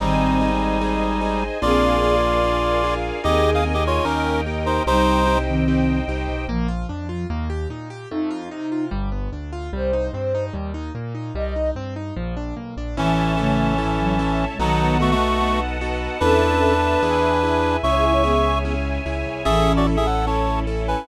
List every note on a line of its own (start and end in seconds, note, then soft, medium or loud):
0.00 1.49 G#1 medium
0.00 0.51 D#3 medium
0.00 1.43 G3 medium
0.00 0.37 C4 loud
0.00 0.51 C4 medium
0.00 1.43 D#4 loud
0.00 0.37 D#4 loud
0.00 0.37 G#4 medium
0.00 1.61 C5 medium
0.00 1.61 D#5 medium
0.00 1.61 G#5 medium
0.41 0.77 C4 medium
0.41 0.77 D#4 medium
0.41 0.77 G#4 medium
0.81 1.18 C4 medium
0.81 1.18 D#4 medium
0.81 1.18 G#4 medium
1.21 1.58 C4 medium
1.21 1.58 D#4 medium
1.21 1.58 G#4 medium
1.62 3.11 A#1 medium
1.62 1.98 A#3 medium
1.62 2.15 C4 medium
1.62 1.98 D4 loud
1.62 1.98 F4 loud
1.62 2.94 F4 loud
1.62 1.98 G#4 medium
1.62 2.15 G#4 medium
1.62 3.22 A#4 medium
1.62 3.22 D5 medium
1.62 2.94 D5 loud
1.62 3.22 F5 medium
1.62 3.22 G#5 medium
2.03 2.39 A#3 medium
2.03 2.39 D4 medium
2.03 2.39 F4 medium
2.03 2.39 G#4 medium
2.44 2.80 A#3 medium
2.44 2.80 D4 medium
2.44 2.80 F4 medium
2.44 2.80 G#4 medium
2.84 3.20 A#3 medium
2.84 3.20 D4 medium
2.84 3.20 F4 medium
2.84 3.20 G#4 medium
3.24 3.99 D#2 medium
3.24 3.60 A#3 medium
3.24 3.74 C4 medium
3.24 3.60 D#4 loud
3.24 3.50 G4 loud
3.24 3.60 G#4 medium
3.24 3.74 G#4 medium
3.24 4.05 A#4 medium
3.24 3.50 D#5 loud
3.24 4.05 D#5 medium
3.24 4.05 G#5 medium
3.54 3.64 G#4 medium
3.54 3.64 F5 loud
3.65 4.01 A#3 medium
3.65 4.01 D#4 medium
3.65 4.01 G#4 medium
3.74 3.84 G4 medium
3.74 3.84 D#5 loud
3.87 4.05 F4 medium
3.87 4.05 C#5 loud
4.05 4.80 D#2 medium
4.05 4.41 A#3 loud
4.05 4.41 C#4 medium
4.05 4.41 D#4 loud
4.05 4.41 G4 loud
4.05 4.41 A#4 loud
4.05 4.86 A#4 medium
4.05 4.85 D#5 medium
4.05 4.85 G5 medium
4.46 4.83 A#3 medium
4.46 4.83 D#4 medium
4.46 4.83 G4 medium
4.66 4.83 D#4 medium
4.66 4.83 C5 loud
4.86 6.02 C2 medium
4.86 5.37 G3 medium
4.86 5.23 C4 medium
4.86 5.38 D#4 loud
4.86 5.37 D#4 medium
4.86 5.23 D#4 medium
4.86 5.23 G4 medium
4.86 6.46 C5 medium
4.86 5.38 C5 loud
4.86 6.46 D#5 medium
4.86 6.46 G5 medium
5.27 5.64 C4 medium
5.27 5.64 D#4 medium
5.27 5.64 G4 medium
5.48 5.99 D#3 medium
5.48 5.99 C4 medium
5.68 6.04 C4 medium
5.68 6.04 D#4 medium
5.68 6.04 G4 medium
6.08 6.26 C2 medium
6.08 6.45 C4 medium
6.08 6.45 D#4 medium
6.08 6.45 G4 medium
6.28 6.46 B1 medium
6.48 6.85 A#1 medium
6.48 7.25 F3 medium
6.48 6.67 A#3 loud
6.68 6.86 F4 medium
6.89 7.26 F2 medium
6.89 7.07 D4 medium
7.09 7.27 F4 medium
7.30 7.66 D#2 medium
7.30 7.48 A#3 loud
7.50 7.68 G4 medium
7.70 8.06 A#2 medium
7.70 7.89 D#4 medium
7.90 8.08 G4 medium
8.10 8.48 F2 medium
8.10 8.30 A3 loud
8.10 8.86 D#4 medium
8.30 8.49 F4 loud
8.51 8.89 C3 medium
8.51 8.70 D#4 medium
8.72 8.90 F4 medium
8.91 9.28 G1 medium
8.91 9.09 G3 loud
9.12 9.30 B3 medium
9.32 9.69 D2 medium
9.32 9.51 D4 medium
9.53 9.71 F4 medium
9.73 10.09 C2 medium
9.73 9.91 G3 loud
9.73 10.45 C5 medium
9.93 10.11 D#4 medium
10.13 10.50 G2 medium
10.13 10.33 C4 medium
10.35 10.53 D#4 medium
10.53 10.90 D#2 medium
10.53 10.72 G3 loud
10.74 10.92 D#4 medium
10.95 11.31 A#2 medium
10.95 11.13 A#3 medium
11.15 11.33 D#4 medium
11.35 11.71 C2 medium
11.35 11.54 G3 loud
11.35 11.70 D#5 medium
11.56 11.74 D#4 medium
11.76 12.12 G2 soft
11.76 11.94 C4 loud
11.96 12.14 D#4 medium
12.16 12.53 A#1 medium
12.16 12.35 F3 loud
12.37 12.55 D4 medium
12.57 12.75 B1 medium
12.57 12.75 A#3 medium
12.77 12.95 A#1 medium
12.77 12.96 D4 medium
12.97 14.46 A1 medium
12.97 14.45 E3 medium
12.97 13.38 E3 medium
12.97 13.34 C#4 loud
12.97 14.45 C#4 loud
12.97 13.38 C#4 medium
12.97 13.34 E4 loud
12.97 13.34 A4 medium
12.97 14.58 C#5 medium
12.97 14.58 E5 medium
12.97 14.58 A5 medium
13.37 13.74 C#3 medium
13.37 13.74 A3 medium
13.37 13.74 C#4 medium
13.37 13.74 E4 medium
13.37 13.74 A4 medium
13.78 13.98 G#2 medium
13.78 13.98 E3 medium
13.78 14.15 C#4 medium
13.78 14.15 E4 medium
13.78 14.15 A4 medium
14.00 14.19 A2 medium
14.00 14.19 F#3 medium
14.19 14.55 C#4 medium
14.19 14.55 E4 medium
14.19 14.55 A4 medium
14.50 14.59 B2 medium
14.50 14.59 G#3 medium
14.59 16.08 B1 medium
14.59 15.14 D#3 medium
14.59 14.98 F#3 loud
14.59 14.96 B3 medium
14.59 15.14 B3 medium
14.59 14.96 D#4 loud
14.59 14.98 D#4 loud
14.59 14.96 F#4 loud
14.59 14.96 A4 medium
14.59 16.20 B4 medium
14.59 16.20 D#5 medium
14.59 16.20 F#5 medium
14.59 16.20 A5 medium
15.00 15.11 A3 medium
15.00 15.36 B3 medium
15.00 15.36 D#4 medium
15.00 15.36 F#4 medium
15.00 15.11 F#4 loud
15.00 15.36 A4 medium
15.11 15.60 A3 loud
15.11 15.60 F#4 loud
15.41 15.77 B3 medium
15.41 15.77 D#4 medium
15.41 15.77 F#4 medium
15.41 15.77 A4 medium
15.81 16.18 B3 medium
15.81 16.18 D#4 medium
15.81 16.18 F#4 medium
15.81 16.18 A4 medium
16.20 16.96 E2 medium
16.20 16.58 B3 medium
16.20 16.73 C#4 medium
16.20 17.76 D4 loud
16.20 16.58 E4 loud
16.20 16.58 A4 medium
16.20 16.73 A4 medium
16.20 17.76 B4 loud
16.20 17.01 B4 medium
16.20 17.01 E5 medium
16.20 17.01 A5 medium
16.62 16.99 B3 medium
16.62 16.99 E4 medium
16.62 16.99 A4 medium
17.02 17.77 E2 medium
17.02 17.39 B3 loud
17.02 17.39 E4 loud
17.02 17.39 G#4 loud
17.02 17.82 B4 medium
17.02 17.82 E5 medium
17.02 17.82 G#5 medium
17.43 17.80 B3 medium
17.43 17.80 E4 medium
17.43 17.80 G#4 medium
17.83 18.99 C#2 medium
17.83 18.21 C#4 medium
17.83 18.21 E4 medium
17.83 17.95 E4 medium
17.83 18.21 G#4 medium
17.83 19.44 C#5 medium
17.83 17.95 C#5 medium
17.83 18.59 E5 loud
17.83 19.44 E5 medium
17.83 19.44 G#5 medium
17.83 18.59 C#6 loud
17.95 18.05 G#4 medium
17.95 18.05 E5 medium
18.04 18.13 E4 medium
18.04 18.13 C#5 medium
18.14 18.23 E4 medium
18.14 18.23 C#5 medium
18.23 18.74 B3 medium
18.23 18.60 C#4 medium
18.23 18.60 E4 medium
18.23 18.74 G#4 medium
18.23 18.60 G#4 medium
18.65 19.01 C#4 medium
18.65 19.01 E4 medium
18.65 19.01 G#4 medium
19.06 19.24 C#2 medium
19.06 19.42 C#4 medium
19.06 19.42 E4 medium
19.06 19.42 G#4 medium
19.26 19.44 C2 medium
19.45 20.95 A1 medium
19.45 19.96 E3 medium
19.45 19.82 C#4 loud
19.45 21.06 C#4 medium
19.45 19.96 C#4 medium
19.45 19.82 E4 loud
19.45 21.06 E4 medium
19.45 19.72 G#4 loud
19.45 19.82 A4 loud
19.45 21.06 A4 medium
19.45 19.72 E5 loud
19.77 19.86 F#4 medium
19.77 19.86 D5 loud
19.87 20.23 C#4 medium
19.87 20.23 E4 medium
19.87 20.23 A4 medium
19.97 20.06 G#4 medium
19.97 20.06 E5 loud
20.06 20.26 A4 medium
20.06 20.26 F#5 medium
20.27 20.63 C#4 medium
20.27 20.63 E4 medium
20.27 20.63 A4 medium
20.27 20.60 C#5 medium
20.27 20.60 A5 medium
20.67 21.04 C#4 medium
20.67 21.04 E4 medium
20.67 21.04 A4 medium
20.88 21.06 B4 medium
20.88 21.06 G#5 loud